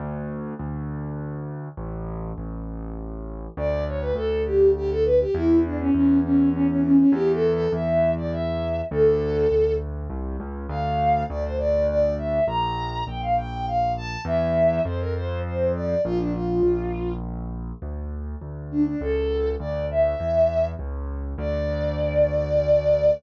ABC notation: X:1
M:3/4
L:1/16
Q:1/4=101
K:D
V:1 name="Violin"
z12 | z12 | d2 c B A2 G2 G A B G | E2 D C C2 C2 C C C C |
(3G2 A2 A2 e3 d e4 | A6 z6 | [K:Dm] f4 d c d2 d2 e2 | b4 g f g2 f2 a2 |
e4 c B c2 c2 d2 | F D F6 z4 | [K:D] z6 D D A4 | d2 e6 z4 |
d12 |]
V:2 name="Acoustic Grand Piano" clef=bass
D,,4 D,,8 | A,,,4 A,,,8 | D,,4 D,,8 | E,,4 E,,8 |
E,,4 E,,8 | D,,4 D,,4 =C,,2 ^C,,2 | [K:Dm] D,,4 D,,8 | B,,,4 B,,,8 |
E,,4 F,,8 | B,,,4 B,,,8 | [K:D] D,,4 D,,4 C,,4 | D,,4 E,,4 C,,4 |
D,,12 |]